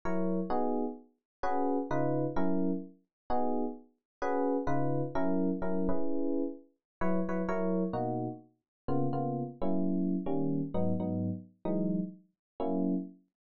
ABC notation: X:1
M:4/4
L:1/8
Q:"Swing" 1/4=129
K:B
V:1 name="Electric Piano 1"
[F,EAc]2 | [B,DFG]4 [CFGB]2 [C,D^EB]2 | [F,CEA]4 [B,DFG]4 | [CFGB]2 [C,D^EB]2 [F,C=EA]2 [F,CEA] [CEGB]- |
[CEGB]4 [F,EBc] [F,EBc] [F,EAc]2 | [B,,A,DF]4 [C,A,B,^E] [C,A,B,E]2 [F,A,C=E]- | [F,A,CE]2 [D,=G,A,C]2 [^G,,F,B,D] [G,,F,B,D]3 | [E,F,G,D]4 [F,A,CE]4 |]